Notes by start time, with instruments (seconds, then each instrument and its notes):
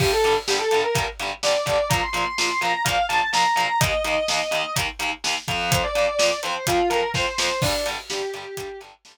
0.00 overdriven guitar G2 D3 G3, distortion guitar G4, kick, crash
0.12 distortion guitar A4
0.24 overdriven guitar G2 D3 G3, closed hi-hat
0.48 overdriven guitar G2 D3 G3, distortion guitar G4, snare
0.58 distortion guitar A4
0.71 overdriven guitar G2 D3 G3, closed hi-hat
0.83 distortion guitar A#4
0.95 overdriven guitar G2 D3 G3, kick, closed hi-hat
1.19 overdriven guitar G2 D3 G3, closed hi-hat
1.43 overdriven guitar G2 D3 G3, distortion guitar D5, snare
1.66 overdriven guitar G2 D3 G3, kick, closed hi-hat
1.89 overdriven guitar A#2 F3 A#3, distortion guitar A#5, kick, closed hi-hat
2.03 distortion guitar C6
2.13 overdriven guitar A#2 F3 A#3, closed hi-hat
2.38 overdriven guitar A#2 F3 A#3, snare
2.61 overdriven guitar A#2 F3 A#3, distortion guitar A#5, closed hi-hat
2.84 overdriven guitar A#2 F3 A#3, distortion guitar F5, kick, closed hi-hat
3.09 overdriven guitar A#2 F3 A#3, distortion guitar A5, closed hi-hat
3.33 overdriven guitar A#2 F3 A#3, distortion guitar A#5, snare
3.56 overdriven guitar A#2 F3 A#3, distortion guitar A#5, closed hi-hat
3.80 overdriven guitar D#2 D#3 A#3, distortion guitar D#5, kick, closed hi-hat
4.04 overdriven guitar D#2 D#3 A#3, closed hi-hat
4.28 overdriven guitar D#2 D#3 A#3, snare
4.51 overdriven guitar D#2 D#3 A#3, closed hi-hat
4.76 overdriven guitar D#2 D#3 A#3, kick, closed hi-hat
4.99 overdriven guitar D#2 D#3 A#3, closed hi-hat
5.24 overdriven guitar D#2 D#3 A#3, snare
5.48 overdriven guitar F2 F3 C4, kick, closed hi-hat
5.72 distortion guitar C5, kick, closed hi-hat
5.83 distortion guitar D5
5.95 overdriven guitar F2 F3 C4, closed hi-hat
6.19 overdriven guitar F2 F3 C4, snare
6.43 overdriven guitar F2 F3 C4, distortion guitar C5, closed hi-hat
6.67 overdriven guitar F2 F3 C4, distortion guitar F4, kick, closed hi-hat
6.90 overdriven guitar F2 F3 C4, distortion guitar A#4, closed hi-hat
7.14 overdriven guitar F2 F3 C4, distortion guitar C5, kick, snare
7.38 overdriven guitar F2 F3 C4, distortion guitar C5, snare
7.62 overdriven guitar G2 D3 G3, distortion guitar D4, kick, crash
7.86 overdriven guitar G2 D3 G3, closed hi-hat
8.10 overdriven guitar G2 D3 G3, distortion guitar G4, snare
8.34 overdriven guitar G2 D3 G3, closed hi-hat
8.57 overdriven guitar G2 D3 G3, kick, closed hi-hat
8.81 overdriven guitar G2 D3 G3, closed hi-hat
9.05 overdriven guitar G2 D3 G3, snare